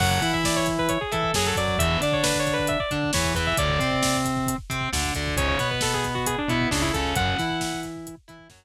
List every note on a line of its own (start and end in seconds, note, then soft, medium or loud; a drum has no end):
0.00 0.19 F#2 loud
0.00 0.20 C#3 medium
0.00 0.20 F#3 medium
0.00 0.10 F#5 medium
0.00 kick medium
0.00 crash medium
0.11 0.32 F#5 medium
0.11 kick medium
0.22 0.98 E3 medium
0.22 0.99 E4 medium
0.22 kick medium
0.22 snare soft
0.22 closed hi-hat medium
0.33 0.44 E5 medium
0.33 kick medium
0.44 0.56 D5 medium
0.44 kick medium
0.44 snare medium
0.56 0.67 C#5 medium
0.56 kick medium
0.66 kick medium
0.66 closed hi-hat medium
0.78 0.89 B4 medium
0.78 kick medium
0.89 1.00 C#5 medium
0.89 kick medium
0.89 closed hi-hat medium
1.01 1.11 G#4 medium
1.01 kick medium
1.12 1.33 E3 medium
1.12 1.31 E4 medium
1.12 1.34 A4 medium
1.12 kick medium
1.12 closed hi-hat medium
1.23 kick medium
1.34 1.53 F#2 medium
1.34 1.54 F#3 medium
1.34 1.46 G#4 medium
1.34 kick medium
1.34 snare loud
1.46 1.57 A4 medium
1.46 kick medium
1.56 1.76 F#2 medium
1.56 1.76 F#3 medium
1.56 1.78 D5 medium
1.56 kick medium
1.56 closed hi-hat medium
1.67 kick medium
1.78 1.97 E2 loud
1.78 2.00 B2 medium
1.78 2.00 E3 medium
1.78 1.98 E5 medium
1.78 kick medium
1.78 closed hi-hat medium
1.90 kick medium
2.01 2.77 D3 medium
2.01 2.78 D4 medium
2.01 2.13 D5 medium
2.01 kick medium
2.01 snare soft
2.01 closed hi-hat medium
2.12 2.24 C#5 medium
2.12 kick medium
2.23 2.37 B4 medium
2.23 kick medium
2.23 snare loud
2.34 kick medium
2.39 2.53 C#5 medium
2.47 kick medium
2.47 closed hi-hat medium
2.53 2.67 B4 medium
2.58 kick medium
2.67 2.79 E5 medium
2.67 kick medium
2.67 closed hi-hat medium
2.80 2.90 D5 medium
2.80 kick medium
2.91 3.11 D3 medium
2.91 3.10 D4 medium
2.91 kick medium
2.91 closed hi-hat medium
3.03 kick medium
3.13 3.34 E2 medium
3.13 3.33 E3 medium
3.13 3.32 C#5 medium
3.13 kick medium
3.13 snare loud
3.24 kick medium
3.34 3.53 E2 loud
3.34 3.55 E3 medium
3.34 3.46 B4 medium
3.34 kick medium
3.34 closed hi-hat medium
3.47 3.57 E5 medium
3.47 kick medium
3.57 3.79 D2 medium
3.57 3.78 A2 medium
3.57 3.78 D3 medium
3.57 4.16 D5 medium
3.57 kick medium
3.57 closed hi-hat medium
3.69 kick medium
3.79 4.55 C3 medium
3.79 4.56 C4 medium
3.79 kick medium
3.79 snare soft
3.79 closed hi-hat medium
3.91 kick medium
4.03 kick medium
4.03 snare loud
4.15 kick medium
4.25 kick medium
4.25 closed hi-hat medium
4.37 kick medium
4.46 kick medium
4.46 closed hi-hat medium
4.58 kick medium
4.70 4.89 C3 medium
4.70 4.89 C4 medium
4.70 kick medium
4.70 closed hi-hat medium
4.81 kick medium
4.93 5.12 D2 medium
4.93 5.12 D3 medium
4.93 kick medium
4.93 snare medium
5.04 kick medium
5.14 5.36 D2 medium
5.14 5.35 D3 medium
5.14 kick medium
5.14 closed hi-hat medium
5.27 kick medium
5.36 5.55 C#2 loud
5.36 5.57 G#2 medium
5.36 5.57 C#3 medium
5.36 5.47 C#5 medium
5.36 kick medium
5.36 closed hi-hat medium
5.48 5.68 C#5 medium
5.48 kick medium
5.59 6.36 B2 medium
5.59 6.36 B3 medium
5.59 kick medium
5.59 snare soft
5.59 closed hi-hat medium
5.71 5.81 B4 medium
5.71 kick medium
5.81 5.93 A4 medium
5.81 kick medium
5.81 snare medium
5.94 6.04 G#4 medium
5.94 kick medium
6.04 kick medium
6.04 closed hi-hat medium
6.15 6.25 F#4 medium
6.15 kick medium
6.26 6.37 G#4 medium
6.26 kick medium
6.26 closed hi-hat loud
6.38 6.49 D4 medium
6.38 kick medium
6.48 6.67 B2 medium
6.48 6.68 B3 medium
6.48 6.69 E4 medium
6.48 kick medium
6.48 closed hi-hat medium
6.61 kick medium
6.71 6.91 C#2 medium
6.71 6.90 C#3 medium
6.71 6.81 D4 medium
6.71 kick medium
6.71 snare medium
6.82 6.92 E4 medium
6.82 kick medium
6.93 7.14 C#2 medium
6.93 7.14 C#3 medium
6.93 7.13 A4 medium
6.93 kick medium
6.93 closed hi-hat medium
7.05 kick medium
7.15 7.35 F#2 loud
7.15 7.37 F#2 medium
7.15 7.37 C#3 medium
7.15 7.80 F#5 medium
7.15 kick loud
7.15 closed hi-hat medium
7.28 kick medium
7.39 8.16 E3 loud
7.39 8.15 E4 medium
7.39 kick medium
7.39 snare soft
7.39 closed hi-hat medium
7.50 kick medium
7.60 kick medium
7.60 snare medium
7.73 kick medium
7.83 kick medium
7.83 closed hi-hat medium
7.96 kick medium
8.07 kick medium
8.07 closed hi-hat medium
8.17 kick medium
8.28 8.48 E3 medium
8.28 8.47 E4 medium
8.28 kick medium
8.28 closed hi-hat medium
8.39 kick medium
8.50 8.64 F#2 medium
8.50 8.64 F#3 medium
8.50 kick medium
8.50 snare medium